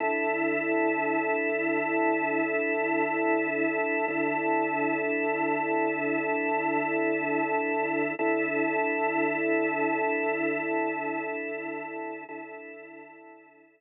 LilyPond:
\new Staff { \time 3/4 \key d \mixolydian \tempo 4 = 88 <d e' a'>2.~ | <d e' a'>2. | <d e' a'>2.~ | <d e' a'>2. |
<d e' a'>2.~ | <d e' a'>2. | <d e' a'>2. | }